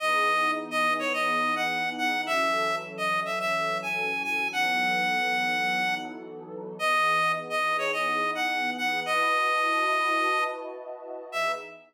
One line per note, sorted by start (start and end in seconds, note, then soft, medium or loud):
0.00 2.25 E3 medium
0.00 2.25 B3 medium
0.00 2.25 D#4 loud
0.00 2.25 G#4 medium
0.00 0.51 D#5 loud
0.71 0.94 D#5 loud
0.99 1.13 C#5 medium
1.13 1.55 D#5 medium
1.56 1.90 F#5 medium
1.98 2.21 F#5 medium
2.26 4.50 E3 medium
2.26 4.50 F#3 medium
2.26 4.50 C#4 medium
2.26 4.50 A4 medium
2.26 2.76 E5 loud
2.98 3.20 D#5 medium
3.25 3.39 E5 medium
3.40 3.78 E5 loud
3.82 4.23 G#5 medium
4.24 4.48 G#5 medium
4.52 6.77 E3 medium
4.52 6.77 F#3 medium
4.52 6.77 B3 medium
4.52 6.77 D#4 medium
4.52 6.77 A4 medium
4.52 5.95 F#5 loud
6.79 9.03 E3 medium
6.79 9.03 B3 medium
6.79 9.03 D#4 medium
6.79 9.03 G#4 medium
6.79 7.32 D#5 loud
7.50 7.77 D#5 medium
7.78 7.92 C#5 medium
7.93 8.31 D#5 medium
8.35 8.70 F#5 medium
8.77 9.00 F#5 medium
9.05 11.29 E4 medium
9.05 11.29 F#4 medium
9.05 11.29 B4 medium
9.05 11.29 D#5 medium
9.05 10.44 D#5 loud
9.05 11.29 A5 medium
11.32 11.54 E3 medium
11.32 11.54 B3 loud
11.32 11.54 D#4 loud
11.32 11.54 G#4 loud
11.32 11.52 E5 loud